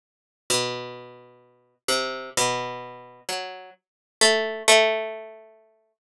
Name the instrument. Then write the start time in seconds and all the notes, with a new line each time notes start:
harpsichord
0.50 B2
1.88 C3
2.37 B2
3.29 F#3
4.21 A3
4.68 A3